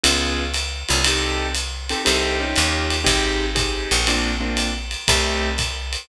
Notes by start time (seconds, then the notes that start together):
0.03 C#2 B3 C#4 F4 G#4, ride
0.54 hi-hat pedal, ride
0.89 C2 B3 C#4 F4 G#4, ride
1.04 C4 D#4 G4 A4, ride
1.55 hi-hat pedal, ride
1.89 C4 D#4 G4 A4, ride
2.05 C2 C4 D#4 G4 A4, ride
2.40 C#4 D#4 F4 G4
2.56 D#2, hi-hat pedal, ride
2.90 ride
3.04 G#1 C4 D#4 G4 G#4, kick, ride
3.55 C4 D#4 G4 G#4, kick, hi-hat pedal, ride
3.91 A#1, ride
4.07 A#3 C4 D4 F4, ride
4.40 A#3 C4 D4 F4
4.57 hi-hat pedal, ride
4.91 ride
5.08 C2 A3 C4 D#4 G4, kick, ride
5.58 kick, hi-hat pedal, ride
5.93 ride